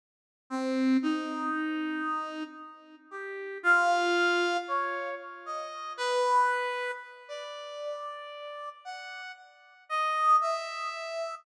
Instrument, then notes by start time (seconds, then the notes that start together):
brass section
0.50 C4
1.02 D#4
3.11 G4
3.63 F4
4.68 C#5
5.46 D#5
5.97 B4
7.28 D5
8.85 F#5
9.89 D#5
10.41 E5